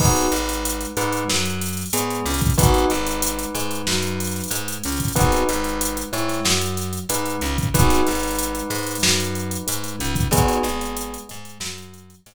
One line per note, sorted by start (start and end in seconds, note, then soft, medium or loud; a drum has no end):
0.00 0.28 G#1 medium
0.00 0.29 B3 medium
0.00 0.29 D#4 medium
0.00 0.82 D#4 medium
0.00 0.29 F#4 medium
0.00 0.29 G#4 medium
0.00 0.82 B4 medium
0.00 kick medium
0.00 crash medium
0.16 closed hi-hat medium
0.31 0.86 G#1 medium
0.31 0.86 G#3 medium
0.31 closed hi-hat medium
0.49 closed hi-hat medium
0.65 closed hi-hat medium
0.81 closed hi-hat medium
0.97 1.24 G#2 medium
0.97 1.24 G#3 medium
0.97 1.23 D#4 medium
0.97 1.23 B4 medium
0.97 closed hi-hat medium
1.12 closed hi-hat medium
1.28 1.85 F#2 medium
1.28 1.83 F#3 medium
1.28 snare medium
1.45 closed hi-hat medium
1.61 closed hi-hat medium
1.68 closed hi-hat medium
1.77 closed hi-hat medium
1.86 closed hi-hat medium
1.93 2.20 G#2 medium
1.93 2.21 G#3 medium
1.93 2.24 B3 medium
1.93 2.24 G#4 medium
1.93 closed hi-hat medium
2.10 closed hi-hat medium
2.26 2.53 C#2 medium
2.26 2.54 C#3 medium
2.26 closed hi-hat medium
2.34 closed hi-hat medium
2.41 kick medium
2.41 closed hi-hat medium
2.50 closed hi-hat medium
2.58 2.85 G#1 medium
2.58 2.87 B3 medium
2.58 2.87 D#4 loud
2.58 4.66 D#4 medium
2.58 2.87 F#4 loud
2.58 2.87 G#4 loud
2.58 4.66 B4 medium
2.58 kick medium
2.58 closed hi-hat medium
2.74 closed hi-hat medium
2.90 3.46 G#1 medium
2.90 3.45 G#3 medium
2.90 closed hi-hat medium
3.07 closed hi-hat medium
3.22 closed hi-hat medium
3.39 closed hi-hat medium
3.55 3.82 G#2 medium
3.55 3.83 G#3 medium
3.55 closed hi-hat medium
3.71 closed hi-hat medium
3.87 4.42 F#2 medium
3.87 4.42 F#3 medium
3.87 snare medium
4.02 closed hi-hat medium
4.20 closed hi-hat medium
4.27 closed hi-hat medium
4.35 snare soft
4.35 closed hi-hat medium
4.44 closed hi-hat medium
4.51 4.78 G#2 medium
4.51 4.79 G#3 medium
4.51 closed hi-hat medium
4.68 closed hi-hat medium
4.84 5.12 C#2 medium
4.84 5.12 C#3 medium
4.84 closed hi-hat medium
4.92 closed hi-hat medium
5.00 kick medium
5.00 closed hi-hat medium
5.08 closed hi-hat medium
5.15 5.44 G#1 medium
5.15 5.44 B3 medium
5.15 5.44 D#4 medium
5.15 5.96 D#4 medium
5.15 5.44 F#4 medium
5.15 5.44 G#4 medium
5.15 5.96 B4 medium
5.15 kick medium
5.15 closed hi-hat medium
5.32 closed hi-hat medium
5.49 6.04 G#1 medium
5.49 6.04 G#3 medium
5.49 closed hi-hat medium
5.64 closed hi-hat medium
5.81 closed hi-hat medium
5.97 closed hi-hat medium
6.12 6.40 G#2 medium
6.12 6.40 G#3 medium
6.12 6.40 E4 medium
6.12 6.40 C#5 medium
6.12 closed hi-hat medium
6.28 snare soft
6.28 closed hi-hat medium
6.45 6.99 F#2 medium
6.45 7.00 F#3 medium
6.45 snare loud
6.61 closed hi-hat medium
6.77 snare soft
6.77 closed hi-hat medium
6.93 closed hi-hat medium
7.09 7.37 G#2 medium
7.09 7.38 G#3 medium
7.09 7.37 D#4 medium
7.09 7.37 B4 medium
7.09 closed hi-hat medium
7.26 closed hi-hat medium
7.41 7.69 C#2 medium
7.41 7.69 C#3 medium
7.41 closed hi-hat medium
7.58 kick medium
7.58 closed hi-hat medium
7.74 8.02 G#1 medium
7.74 8.03 B3 loud
7.74 10.25 D#4 medium
7.74 8.03 D#4 medium
7.74 8.03 F#4 medium
7.74 8.03 G#4 medium
7.74 10.25 B4 medium
7.74 kick medium
7.74 closed hi-hat medium
7.90 snare soft
7.90 closed hi-hat medium
8.06 8.62 G#1 medium
8.06 8.61 G#3 medium
8.06 closed hi-hat medium
8.15 closed hi-hat medium
8.23 closed hi-hat medium
8.31 closed hi-hat medium
8.39 closed hi-hat medium
8.55 closed hi-hat medium
8.70 8.98 G#2 medium
8.70 8.97 G#3 medium
8.70 closed hi-hat medium
8.78 closed hi-hat medium
8.87 closed hi-hat medium
8.95 closed hi-hat medium
9.03 9.58 F#2 medium
9.03 9.58 F#3 medium
9.03 snare loud
9.20 closed hi-hat medium
9.35 closed hi-hat medium
9.51 closed hi-hat medium
9.67 9.96 G#2 medium
9.67 9.94 G#3 medium
9.67 closed hi-hat medium
9.84 closed hi-hat medium
9.99 10.28 C#2 medium
9.99 10.26 C#3 medium
9.99 closed hi-hat medium
10.15 kick medium
10.15 closed hi-hat medium
10.31 10.58 G#1 medium
10.31 11.14 B3 medium
10.31 10.62 B3 medium
10.31 10.62 D#4 medium
10.31 10.62 F#4 medium
10.31 11.14 G#4 medium
10.31 10.62 G#4 loud
10.31 kick medium
10.31 closed hi-hat medium
10.48 closed hi-hat medium
10.63 11.18 G#1 medium
10.63 11.19 G#3 medium
10.63 closed hi-hat medium
10.81 closed hi-hat medium
10.97 closed hi-hat medium
11.14 closed hi-hat medium
11.29 11.58 G#2 medium
11.29 11.56 G#3 medium
11.29 closed hi-hat medium
11.45 closed hi-hat medium
11.60 12.15 F#2 medium
11.60 12.15 F#3 medium
11.60 snare loud
11.78 closed hi-hat medium
11.94 closed hi-hat medium
12.10 closed hi-hat medium
12.26 12.34 G#2 medium
12.26 12.34 G#3 medium
12.26 closed hi-hat medium